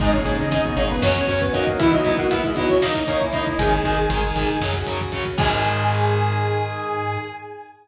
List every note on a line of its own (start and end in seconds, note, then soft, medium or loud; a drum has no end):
0.00 0.22 G#1 loud
0.00 0.11 G#2 medium
0.00 0.11 G#3 loud
0.00 0.10 D#4 medium
0.00 1.01 D#4 medium
0.00 0.13 D#4 medium
0.00 0.10 G#4 medium
0.00 1.01 G#4 medium
0.00 0.13 D#5 loud
0.00 kick medium
0.00 crash medium
0.12 0.24 A#2 medium
0.12 0.24 A#3 medium
0.12 0.34 C#4 medium
0.12 0.34 C#5 medium
0.12 kick medium
0.25 0.47 G#1 medium
0.25 0.36 D#4 medium
0.25 0.36 G#4 medium
0.25 kick medium
0.25 closed hi-hat medium
0.39 0.51 C#3 medium
0.39 0.51 C#4 medium
0.39 0.51 D#4 medium
0.39 0.51 D#5 medium
0.39 kick medium
0.51 0.73 G#1 medium
0.51 0.75 D#4 medium
0.51 0.62 D#4 medium
0.51 0.62 G#4 medium
0.51 0.75 D#5 medium
0.51 kick medium
0.51 closed hi-hat medium
0.64 0.76 B2 medium
0.64 0.76 B3 medium
0.64 kick medium
0.75 0.99 G#1 medium
0.75 1.01 A#2 medium
0.75 1.01 A#3 loud
0.75 0.88 C#4 medium
0.75 0.87 D#4 medium
0.75 0.87 G#4 medium
0.75 0.88 C#5 medium
0.75 kick medium
0.75 closed hi-hat medium
0.90 1.03 B3 medium
0.90 1.03 B4 medium
0.90 kick medium
1.01 1.24 F#2 loud
1.01 1.25 C#4 medium
1.01 1.13 C#4 medium
1.01 1.40 C#4 loud
1.01 1.79 C#4 medium
1.01 1.13 F#4 medium
1.01 1.79 F#4 medium
1.01 1.25 C#5 medium
1.01 1.40 C#5 loud
1.01 kick medium
1.01 snare medium
1.16 kick medium
1.27 1.50 F#2 medium
1.27 1.38 C#4 medium
1.27 1.53 C#4 medium
1.27 1.38 F#4 medium
1.27 1.53 C#5 medium
1.27 kick medium
1.27 closed hi-hat medium
1.40 1.52 B3 medium
1.40 1.52 B4 medium
1.40 kick medium
1.53 1.76 F#2 medium
1.53 1.76 A#3 medium
1.53 1.64 C#4 medium
1.53 1.77 D#4 medium
1.53 1.64 F#4 medium
1.53 1.76 A#4 medium
1.53 1.77 D#5 medium
1.53 kick medium
1.53 closed hi-hat medium
1.67 kick medium
1.79 1.92 E3 medium
1.79 2.81 B3 medium
1.79 1.90 B3 medium
1.79 1.91 E4 medium
1.79 2.81 E4 medium
1.79 1.92 E4 loud
1.79 1.90 E4 medium
1.79 1.91 E5 medium
1.79 kick medium
1.79 closed hi-hat medium
1.91 2.05 F#3 medium
1.91 2.15 D#4 medium
1.91 2.05 F#4 medium
1.91 2.15 D#5 medium
1.91 kick medium
2.04 2.16 B3 medium
2.04 2.16 E4 medium
2.04 kick medium
2.04 closed hi-hat medium
2.17 2.30 A#3 medium
2.17 2.31 F#4 medium
2.17 2.30 A#4 medium
2.17 2.31 F#5 medium
2.17 kick medium
2.31 2.41 B3 medium
2.31 2.52 E4 medium
2.31 2.41 E4 medium
2.31 2.52 E5 medium
2.31 kick medium
2.31 closed hi-hat medium
2.44 2.57 G#3 medium
2.44 2.57 G#4 medium
2.44 kick medium
2.54 2.79 F#3 medium
2.54 2.67 B3 medium
2.54 2.67 D#4 medium
2.54 2.67 E4 medium
2.54 2.79 F#4 medium
2.54 2.67 D#5 medium
2.54 kick medium
2.54 closed hi-hat medium
2.69 2.81 C#4 medium
2.69 2.81 C#5 medium
2.69 kick medium
2.82 3.58 A#3 medium
2.82 2.92 A#3 medium
2.82 3.15 D#4 medium
2.82 3.03 D#4 medium
2.82 3.58 D#4 medium
2.82 2.92 D#4 medium
2.82 3.15 D#5 medium
2.82 3.03 D#5 medium
2.82 kick medium
2.82 snare medium
2.95 kick medium
3.07 3.18 A#3 medium
3.07 3.29 C#4 medium
3.07 3.18 D#4 medium
3.07 3.29 C#5 medium
3.07 kick medium
3.07 closed hi-hat medium
3.21 3.33 E4 medium
3.21 3.33 E5 medium
3.21 kick medium
3.33 3.44 A#3 medium
3.33 3.44 D#4 medium
3.33 3.57 D#4 medium
3.33 3.58 E4 medium
3.33 3.57 D#5 medium
3.33 3.58 E5 medium
3.33 kick medium
3.33 closed hi-hat medium
3.47 kick medium
3.59 3.80 G#1 loud
3.59 3.69 D#3 medium
3.59 4.54 D#3 medium
3.59 3.69 G#3 medium
3.59 4.54 D#4 medium
3.59 4.60 G#4 medium
3.59 4.66 G#4 medium
3.59 4.60 D#5 medium
3.59 4.66 G#5 loud
3.59 kick medium
3.59 closed hi-hat medium
3.72 kick medium
3.83 4.07 G#1 medium
3.83 3.95 D#3 medium
3.83 3.95 G#3 medium
3.83 kick medium
3.83 closed hi-hat medium
3.97 kick medium
4.09 4.32 G#1 medium
4.09 4.21 D#3 medium
4.09 4.21 G#3 medium
4.09 kick medium
4.09 closed hi-hat medium
4.23 kick medium
4.36 4.57 G#1 medium
4.36 4.46 D#3 medium
4.36 4.46 G#3 medium
4.36 kick medium
4.36 closed hi-hat medium
4.48 kick medium
4.60 4.83 F#2 medium
4.60 4.72 C#3 medium
4.60 4.72 F#3 medium
4.60 5.38 F#4 medium
4.60 5.38 C#5 medium
4.60 kick medium
4.60 snare medium
4.73 kick medium
4.87 5.09 F#2 medium
4.87 4.98 C#3 medium
4.87 4.98 F#3 medium
4.87 kick medium
4.87 closed hi-hat medium
5.01 kick medium
5.12 5.35 F#2 medium
5.12 5.23 C#3 medium
5.12 5.23 F#3 medium
5.12 kick medium
5.12 closed hi-hat medium
5.26 kick medium
5.38 7.18 G#2 loud
5.38 7.18 D#3 loud
5.38 7.18 G#3 loud
5.38 7.17 D#4 loud
5.38 7.17 G#4 loud
5.38 7.18 G#4 loud
5.38 7.17 G#5 loud
5.38 kick loud
5.38 crash loud